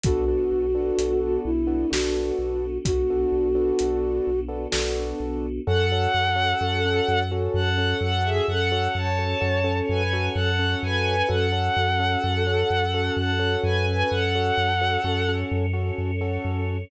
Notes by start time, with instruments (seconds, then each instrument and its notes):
0.04 synth bass 2 B1, choir aahs B3 D4 F#4 A4, acoustic grand piano B3 D4 F#4 A4, flute F#4, kick, closed hi-hat
0.28 acoustic grand piano B3 D4 F#4 A4
0.52 synth bass 2 B1
0.75 acoustic grand piano B3 D4 F#4 A4
0.98 synth bass 2 B1, closed hi-hat
1.45 synth bass 2 B1, flute E4
1.67 acoustic grand piano B3 D4 F#4 A4
1.90 synth bass 2 B1, acoustic grand piano B3 D4 F#4 A4, flute F#4, snare
2.39 synth bass 2 B1
2.85 synth bass 2 B1, flute F#4, kick, closed hi-hat
3.10 acoustic grand piano B3 D4 F#4 A4
3.32 synth bass 2 B1
3.55 acoustic grand piano B3 D4 F#4 A4
3.79 synth bass 2 B1, closed hi-hat
4.27 synth bass 2 B1
4.48 acoustic grand piano B3 D4 F#4 A4
4.71 synth bass 2 B1, acoustic grand piano B3 D4 F#4 A4, snare
5.20 synth bass 2 B1
5.67 synth bass 2 F#2, acoustic grand piano C#4 F#4 A4, choir aahs C#4 F#4 A4, violin A4 F#5
5.92 acoustic grand piano C#4 F#4 A4
6.14 synth bass 2 F#2
6.36 acoustic grand piano C#4 F#4 A4
6.61 synth bass 2 F#2, acoustic grand piano C#4 F#4 A4
6.85 acoustic grand piano C#4 F#4 A4
7.08 synth bass 2 F#2
7.31 acoustic grand piano C#4 F#4 A4
7.54 synth bass 2 F#2, violin A4 F#5
7.78 acoustic grand piano C#4 F#4 A4
8.01 synth bass 2 F#2, violin A4 F#5
8.24 violin G#4 E5
8.48 synth bass 2 F#2, choir aahs C#4 A4 C#5, violin A4 F#5
8.72 acoustic grand piano C#4 F#4 A4
8.95 synth bass 2 F#2, violin C#5 A5
9.18 acoustic grand piano C#4 F#4 A4
9.41 synth bass 2 F#2, acoustic grand piano C#4 F#4 A4
9.64 acoustic grand piano C#4 F#4 A4
9.89 synth bass 2 F#2, violin B4 G#5
10.13 acoustic grand piano C#4 F#4 A4
10.35 synth bass 2 F#2, violin A4 F#5
10.59 acoustic grand piano C#4 F#4 A4
10.83 synth bass 2 F#2, violin B4 G#5
11.28 synth bass 2 F#2, acoustic grand piano C#4 F#4 A4, choir aahs C#4 F#4 A4, violin A4 F#5
11.52 acoustic grand piano C#4 F#4 A4
11.77 synth bass 2 F#2
11.99 acoustic grand piano C#4 F#4 A4
12.23 synth bass 2 F#2, acoustic grand piano C#4 F#4 A4
12.47 acoustic grand piano C#4 F#4 A4
12.70 synth bass 2 F#2
12.94 acoustic grand piano C#4 F#4 A4
13.17 synth bass 2 F#2, violin A4 F#5
13.39 acoustic grand piano C#4 F#4 A4
13.63 synth bass 2 F#2, violin B4 G#5
13.88 violin B4 G#5
14.10 synth bass 2 F#2, choir aahs C#4 A4 C#5, violin A4 F#5
14.35 acoustic grand piano C#4 F#4 A4
14.57 synth bass 2 F#2
14.81 acoustic grand piano C#4 F#4 A4
15.04 synth bass 2 F#2, acoustic grand piano C#4 F#4 A4
15.28 acoustic grand piano C#4 F#4 A4
15.51 synth bass 2 F#2
15.73 acoustic grand piano C#4 F#4 A4
15.98 synth bass 2 F#2
16.21 acoustic grand piano C#4 F#4 A4
16.45 synth bass 2 F#2